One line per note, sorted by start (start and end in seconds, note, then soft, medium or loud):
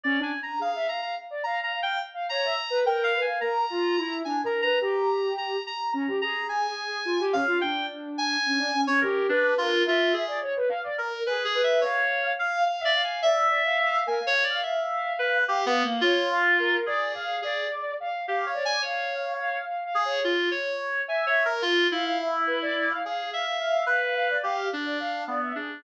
0.04 0.17 C#4 loud
0.04 0.20 D5 medium
0.19 0.31 D4 loud
0.19 0.39 G#5 medium
0.43 0.59 A#5 medium
0.59 0.72 G#4 medium
0.59 0.87 F5 medium
0.75 0.88 E5 medium
0.88 1.01 F5 medium
0.88 1.01 A#5 medium
1.02 1.15 F5 medium
1.02 1.15 A#5 medium
1.30 1.43 D5 medium
1.43 1.58 F5 medium
1.43 1.60 A#5 medium
1.59 1.72 F5 medium
1.63 1.80 A#5 medium
1.72 1.97 F5 medium
1.82 1.99 G5 loud
2.14 2.27 F5 medium
2.29 2.43 C#5 loud
2.29 2.80 A#5 medium
2.44 2.57 E5 medium
2.70 2.83 B4 medium
2.84 3.10 A#4 loud
2.84 3.03 G5 medium
3.04 3.20 F5 loud
3.13 3.26 B4 medium
3.21 3.38 G#5 medium
3.27 3.40 F5 medium
3.40 3.65 A#4 medium
3.40 4.16 A#5 medium
3.70 3.95 F4 loud
3.97 4.22 E4 loud
4.25 4.42 D4 medium
4.25 4.41 G#5 medium
4.44 4.61 A#4 medium
4.44 4.61 A#5 medium
4.62 4.79 B4 medium
4.62 4.79 A#5 loud
4.81 5.57 G4 medium
4.81 5.33 A#5 medium
5.38 5.63 A#5 medium
5.66 5.92 A#5 medium
5.92 6.06 C#4 medium
5.92 6.17 A#5 medium
6.07 6.20 G4 medium
6.21 6.97 G#4 medium
6.21 6.47 A#5 loud
6.49 7.24 G#5 medium
7.05 7.18 F4 loud
7.20 7.33 G4 loud
7.32 7.45 C#4 loud
7.32 7.58 F5 loud
7.48 7.60 F4 loud
7.61 8.37 D4 medium
7.61 7.86 G5 loud
8.18 8.81 G#5 loud
8.46 8.59 C#4 medium
8.58 8.71 D4 loud
8.73 8.86 C#4 medium
8.87 9.00 C#4 loud
8.87 9.00 C#5 loud
9.01 9.27 G4 medium
9.01 9.26 A#4 medium
9.29 9.54 D4 medium
9.29 9.54 B4 loud
9.58 9.83 F4 loud
9.58 9.83 A#4 medium
9.86 10.13 F4 medium
9.86 10.24 E5 medium
10.13 10.39 G#4 medium
10.28 10.40 D5 medium
10.41 10.54 C#5 medium
10.56 10.69 B4 medium
10.69 10.82 F5 loud
10.83 10.96 D5 loud
10.98 11.23 A#4 medium
11.13 11.25 A#4 medium
11.26 11.52 G#4 loud
11.26 11.43 B4 medium
11.45 11.61 G#4 medium
11.54 11.80 B4 loud
11.63 11.80 E5 medium
11.81 12.32 C#5 medium
11.81 12.33 F5 medium
12.39 12.64 F5 medium
12.39 12.64 F5 loud
12.66 12.83 F5 medium
12.66 12.80 F5 medium
12.79 12.92 E5 medium
12.85 13.02 D5 loud
12.95 13.20 F5 loud
13.04 13.21 G#5 medium
13.22 13.47 D5 medium
13.22 13.98 E5 loud
13.49 13.62 D5 medium
13.65 13.77 F5 loud
13.78 14.04 F5 loud
14.06 14.19 A#4 medium
14.06 14.24 G#5 medium
14.20 14.33 F5 medium
14.27 14.43 C#5 loud
14.44 14.60 D5 medium
14.50 14.61 F5 loud
14.62 15.13 E5 medium
14.62 15.38 F5 medium
15.19 15.44 B4 medium
15.47 15.65 G4 loud
15.47 15.64 F5 medium
15.66 15.83 B3 loud
15.66 15.82 F5 medium
15.84 16.01 A#3 medium
15.84 16.01 F5 medium
16.01 16.77 F4 loud
16.01 16.28 C#5 medium
16.31 16.57 F5 loud
16.59 16.84 A#4 loud
16.86 17.37 G#4 medium
16.86 17.12 D5 loud
17.14 17.40 F5 loud
17.42 17.67 G#4 medium
17.42 17.94 D5 loud
18.00 18.25 F5 medium
18.27 18.45 G4 medium
18.27 18.52 F5 medium
18.46 18.63 C#5 medium
18.54 18.79 D5 medium
18.65 18.82 G#5 loud
18.82 19.58 C#5 medium
18.82 19.34 F5 medium
19.39 19.65 F5 medium
19.67 19.84 F5 medium
19.85 20.02 F5 medium
19.95 20.20 G#4 medium
20.05 20.22 C#5 medium
20.24 20.49 F4 medium
20.51 21.02 C#5 medium
21.08 21.46 E5 loud
21.08 21.25 G#5 medium
21.26 21.43 C#5 medium
21.45 21.62 A#4 loud
21.62 21.87 F4 loud
21.91 22.92 E4 medium
21.91 22.04 F5 medium
22.05 22.18 F5 medium
22.19 22.44 E5 medium
22.47 22.59 B4 medium
22.62 22.75 D5 loud
22.76 22.88 D5 loud
22.90 23.02 F5 loud
23.04 23.30 G#4 medium
23.04 23.30 F5 medium
23.33 23.84 E5 medium
23.33 23.45 F5 medium
23.45 23.58 F5 medium
23.59 23.84 F5 loud
23.86 24.37 B4 medium
23.86 24.00 F5 medium
24.02 24.14 F5 medium
24.15 24.28 F5 loud
24.30 24.43 D5 medium
24.43 24.68 G4 medium
24.43 24.69 F5 medium
24.73 25.23 D4 medium
24.85 24.98 D5 medium
25.00 25.25 F5 medium
25.27 25.53 B3 soft
25.27 25.40 D5 medium
25.42 25.55 E5 medium
25.55 25.81 D4 medium
25.55 25.68 G#4 soft